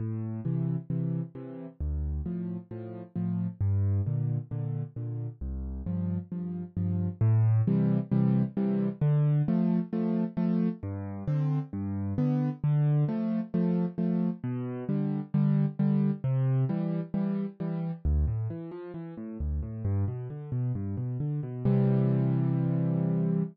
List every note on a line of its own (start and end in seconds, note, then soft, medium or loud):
0.00 0.40 A2 medium
0.45 0.76 C3 medium
0.45 0.76 E3 medium
0.90 1.22 C3 medium
0.90 1.22 E3 medium
1.35 1.67 C3 medium
1.35 1.67 E3 medium
1.81 2.21 D2 medium
2.26 2.57 A2 medium
2.26 2.57 F3 medium
2.71 3.02 A2 medium
2.71 3.02 F3 medium
3.16 3.47 A2 medium
3.16 3.47 F3 medium
3.61 4.01 G2 loud
4.06 4.38 A#2 medium
4.06 4.38 D3 medium
4.51 4.83 A#2 medium
4.51 4.83 D3 medium
4.96 5.28 A#2 medium
4.96 5.28 D3 medium
5.41 5.82 C2 medium
5.86 6.18 G2 medium
5.86 6.18 F3 medium
6.32 6.63 G2 medium
6.32 6.63 F3 medium
6.77 7.08 G2 medium
6.77 7.08 F3 medium
7.21 7.62 A2 loud
7.67 7.99 C3 medium
7.67 7.99 E3 medium
7.67 7.99 G3 medium
8.12 8.43 C3 medium
8.12 8.43 E3 medium
8.12 8.43 G3 medium
8.57 8.88 C3 medium
8.57 8.88 E3 medium
8.57 8.88 G3 medium
9.01 9.42 D3 loud
9.48 9.80 F3 medium
9.48 9.80 A3 medium
9.93 10.24 F3 medium
9.93 10.24 A3 medium
10.37 10.69 F3 medium
10.37 10.69 A3 loud
10.83 11.23 G2 loud
11.28 11.59 D3 medium
11.28 11.59 C4 medium
11.73 12.14 G2 loud
12.18 12.50 D3 medium
12.18 12.50 B3 medium
12.64 13.04 D3 loud
13.08 13.40 F3 medium
13.08 13.40 A3 medium
13.54 13.86 F3 medium
13.54 13.86 A3 medium
13.98 14.30 F3 medium
13.98 14.30 A3 medium
14.44 14.84 B2 loud
14.89 15.20 D3 medium
14.89 15.20 G3 medium
15.34 15.66 D3 loud
15.34 15.66 G3 medium
15.79 16.11 D3 medium
15.79 16.11 G3 medium
16.24 16.65 C3 loud
16.69 17.01 E3 medium
16.69 17.01 G3 medium
17.14 17.46 E3 medium
17.14 17.46 G3 medium
17.60 17.92 E3 medium
17.60 17.92 G3 medium
18.05 18.25 D2 loud
18.28 18.48 A2 medium
18.50 18.70 E3 medium
18.71 18.92 F3 medium
18.94 19.14 E3 medium
19.17 19.38 A2 medium
19.40 19.61 D2 medium
19.63 19.83 A2 medium
19.85 20.05 G2 loud
20.08 20.28 B2 medium
20.30 20.50 D3 medium
20.52 20.72 B2 medium
20.75 20.96 G2 medium
20.97 21.18 B2 medium
21.20 21.40 D3 medium
21.43 21.63 B2 medium
21.65 23.43 C3 loud
21.65 23.43 E3 loud
21.65 23.43 G3 medium